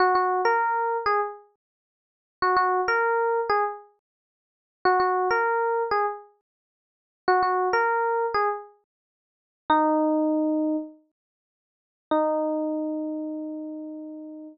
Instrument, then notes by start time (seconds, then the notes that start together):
electric piano 1
0.00 F#4
0.15 F#4
0.45 A#4
1.06 G#4
2.42 F#4
2.57 F#4
2.88 A#4
3.49 G#4
4.85 F#4
5.00 F#4
5.31 A#4
5.91 G#4
7.28 F#4
7.43 F#4
7.73 A#4
8.34 G#4
9.70 D#4
12.11 D#4